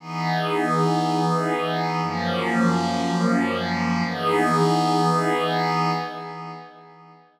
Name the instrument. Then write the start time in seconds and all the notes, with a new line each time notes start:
pad 5 (bowed)
0.00 E3 B3 D#4 G#4
2.02 F#2 F3 A#3 C#4
4.06 E3 B3 D#4 G#4